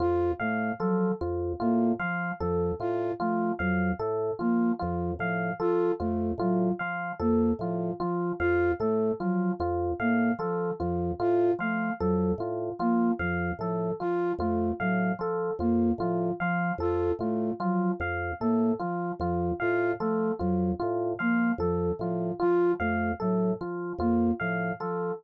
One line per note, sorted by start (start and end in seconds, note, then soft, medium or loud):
0.00 0.32 F2 medium
0.00 0.32 F4 medium
0.40 0.72 A2 medium
0.40 0.72 A3 medium
0.40 0.72 F5 medium
0.80 1.12 F3 medium
0.80 1.12 F#3 medium
0.80 1.12 A4 medium
1.21 1.53 F2 medium
1.21 1.53 F4 medium
1.60 1.93 A2 medium
1.60 1.92 A#3 medium
1.60 1.92 F4 medium
2.00 2.31 F3 medium
2.00 2.32 F3 medium
2.00 2.31 F5 medium
2.40 2.73 F2 medium
2.40 2.72 F3 medium
2.40 2.72 A4 medium
2.80 3.12 A2 medium
2.80 3.12 F4 medium
3.20 3.53 F3 medium
3.20 3.52 A3 medium
3.20 3.52 F4 medium
3.59 3.92 F2 medium
3.59 3.92 F#3 medium
3.59 3.91 F5 medium
3.99 4.31 A2 medium
3.99 4.32 A4 medium
4.39 4.73 F3 medium
4.39 4.72 A#3 medium
4.39 4.71 F4 medium
4.79 5.14 F2 medium
4.79 5.12 F3 medium
4.79 5.11 F4 medium
5.19 5.51 A2 medium
5.19 5.52 F3 medium
5.19 5.52 F5 medium
5.60 5.92 F3 medium
5.60 5.92 F4 medium
5.60 5.92 A4 medium
6.00 6.32 F2 medium
6.00 6.32 A3 medium
6.00 6.32 F4 medium
6.38 6.70 A2 medium
6.38 6.72 F#3 medium
6.38 6.72 F4 medium
6.79 7.13 F3 medium
6.79 7.11 F5 medium
7.20 7.52 F2 medium
7.20 7.52 A#3 medium
7.20 7.52 A4 medium
7.59 7.91 A2 medium
7.59 7.92 F3 medium
7.59 7.93 F4 medium
8.00 8.32 F3 medium
8.00 8.33 F3 medium
8.00 8.32 F4 medium
8.40 8.72 F2 medium
8.40 8.72 F4 medium
8.40 8.72 F5 medium
8.80 9.12 A2 medium
8.80 9.12 A3 medium
8.80 9.12 A4 medium
9.20 9.52 F3 medium
9.20 9.52 F#3 medium
9.20 9.52 F4 medium
9.60 9.92 F2 medium
9.60 9.92 F4 medium
10.00 10.32 A2 medium
10.00 10.32 A#3 medium
10.00 10.32 F5 medium
10.39 10.71 F3 medium
10.39 10.72 F3 medium
10.39 10.71 A4 medium
10.80 11.12 F2 medium
10.80 11.12 F3 medium
10.80 11.12 F4 medium
11.20 11.52 A2 medium
11.20 11.52 F4 medium
11.59 11.91 F3 medium
11.59 11.92 A3 medium
11.59 11.92 F5 medium
12.00 12.32 F2 medium
12.00 12.32 F#3 medium
12.00 12.32 A4 medium
12.38 12.70 A2 medium
12.38 12.72 F4 medium
12.79 13.11 F3 medium
12.79 13.12 A#3 medium
12.79 13.12 F4 medium
13.19 13.51 F2 medium
13.19 13.52 F3 medium
13.19 13.51 F5 medium
13.59 13.91 A2 medium
13.59 13.92 F3 medium
13.59 13.93 A4 medium
14.00 14.33 F3 medium
14.00 14.32 F4 medium
14.39 14.71 F2 medium
14.39 14.72 A3 medium
14.39 14.72 F4 medium
14.80 15.12 A2 medium
14.80 15.12 F#3 medium
14.80 15.12 F5 medium
15.19 15.51 F3 medium
15.19 15.53 A4 medium
15.59 15.91 F2 medium
15.59 15.92 A#3 medium
15.59 15.92 F4 medium
15.98 16.30 A2 medium
15.98 16.32 F3 medium
15.98 16.32 F4 medium
16.40 16.72 F3 medium
16.40 16.73 F3 medium
16.40 16.72 F5 medium
16.78 17.10 F2 medium
16.78 17.12 F4 medium
16.78 17.12 A4 medium
17.19 17.51 A2 medium
17.19 17.52 A3 medium
17.19 17.53 F4 medium
17.60 17.92 F3 medium
17.60 17.92 F#3 medium
17.60 17.92 F4 medium
18.00 18.32 F2 medium
18.00 18.33 F5 medium
18.40 18.73 A2 medium
18.40 18.72 A#3 medium
18.40 18.73 A4 medium
18.80 19.12 F3 medium
18.80 19.12 F4 medium
19.20 19.52 F2 medium
19.20 19.52 F3 medium
19.20 19.53 F4 medium
19.60 19.94 A2 medium
19.60 19.92 F4 medium
19.60 19.92 F5 medium
20.00 20.32 F3 medium
20.00 20.32 A3 medium
20.00 20.32 A4 medium
20.39 20.73 F2 medium
20.39 20.72 F#3 medium
20.39 20.71 F4 medium
20.80 21.14 A2 medium
20.80 21.12 F4 medium
21.19 21.52 F3 medium
21.19 21.52 A#3 medium
21.19 21.51 F5 medium
21.58 21.90 F2 medium
21.58 21.92 F3 medium
21.58 21.92 A4 medium
21.99 22.31 A2 medium
21.99 22.32 F3 medium
21.99 22.33 F4 medium
22.40 22.74 F3 medium
22.40 22.71 F4 medium
22.40 22.72 F4 medium
22.80 23.12 F2 medium
22.80 23.12 A3 medium
22.80 23.12 F5 medium
23.20 23.54 A2 medium
23.20 23.52 F#3 medium
23.20 23.52 A4 medium
23.61 23.93 F3 medium
23.61 23.93 F4 medium
23.99 24.31 F2 medium
23.99 24.32 A#3 medium
23.99 24.32 F4 medium
24.40 24.73 A2 medium
24.40 24.72 F3 medium
24.40 24.72 F5 medium
24.80 25.12 F3 medium
24.80 25.12 A4 medium